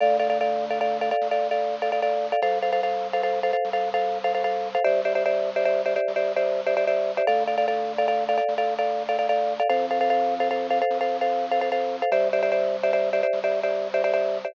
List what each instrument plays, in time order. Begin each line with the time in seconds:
0.01 drawbar organ D2, marimba A4 D5 F5
0.20 marimba A4 D5 F5
0.30 marimba A4 D5 F5
0.41 marimba A4 D5 F5
0.70 marimba A4 D5 F5
0.81 marimba A4 D5 F5
1.01 marimba A4 D5 F5
1.11 marimba A4 D5 F5
1.21 drawbar organ D2
1.31 marimba A4 D5 F5
1.51 marimba A4 D5 F5
1.82 marimba A4 D5 F5
1.92 marimba A4 D5 F5
2.02 marimba A4 D5 F5
2.32 marimba A4 D5 F5
2.42 drawbar organ C2, marimba A4 C5 F5
2.62 marimba A4 C5 F5
2.72 marimba A4 C5 F5
2.83 marimba A4 C5 F5
3.13 marimba A4 C5 F5
3.23 marimba A4 C5 F5
3.43 marimba A4 C5 F5
3.53 marimba A4 C5 F5
3.65 drawbar organ C2
3.73 marimba A4 C5 F5
3.94 marimba A4 C5 F5
4.24 marimba A4 C5 F5
4.35 marimba A4 C5 F5
4.44 marimba A4 C5 F5
4.75 marimba A4 C5 F5
4.84 drawbar organ C2, marimba G4 C5 D5 E5
5.05 marimba G4 C5 D5 E5
5.15 marimba G4 C5 D5 E5
5.26 marimba G4 C5 D5 E5
5.56 marimba G4 C5 D5 E5
5.65 marimba G4 C5 D5 E5
5.86 marimba G4 C5 D5 E5
5.96 marimba G4 C5 D5 E5
6.08 drawbar organ C2
6.16 marimba G4 C5 D5 E5
6.36 marimba G4 C5 D5 E5
6.66 marimba G4 C5 D5 E5
6.77 marimba G4 C5 D5 E5
6.87 marimba G4 C5 D5 E5
7.17 marimba G4 C5 D5 E5
7.27 drawbar organ D2, marimba A4 D5 F5
7.47 marimba A4 D5 F5
7.58 marimba A4 D5 F5
7.68 marimba A4 D5 F5
7.98 marimba A4 D5 F5
8.08 marimba A4 D5 F5
8.29 marimba A4 D5 F5
8.38 marimba A4 D5 F5
8.48 drawbar organ D2
8.58 marimba A4 D5 F5
8.79 marimba A4 D5 F5
9.09 marimba A4 D5 F5
9.19 marimba A4 D5 F5
9.29 marimba A4 D5 F5
9.60 marimba A4 D5 F5
9.70 drawbar organ F2, marimba A4 C5 F5
9.91 marimba A4 C5 F5
10.01 marimba A4 C5 F5
10.10 marimba A4 C5 F5
10.40 marimba A4 C5 F5
10.51 marimba A4 C5 F5
10.70 marimba A4 C5 F5
10.82 marimba A4 C5 F5
10.90 drawbar organ F2
11.01 marimba A4 C5 F5
11.21 marimba A4 C5 F5
11.51 marimba A4 C5 F5
11.61 marimba A4 C5 F5
11.72 marimba A4 C5 F5
12.02 marimba A4 C5 F5
12.12 drawbar organ C2, marimba G4 C5 D5 E5
12.33 marimba G4 C5 D5 E5
12.43 marimba G4 C5 D5 E5
12.52 marimba G4 C5 D5 E5
12.83 marimba G4 C5 D5 E5
12.93 marimba G4 C5 D5 E5
13.13 marimba G4 C5 D5 E5
13.23 marimba G4 C5 D5 E5
13.33 drawbar organ C2
13.44 marimba G4 C5 D5 E5
13.63 marimba G4 C5 D5 E5
13.94 marimba G4 C5 D5 E5
14.04 marimba G4 C5 D5 E5
14.14 marimba G4 C5 D5 E5
14.45 marimba G4 C5 D5 E5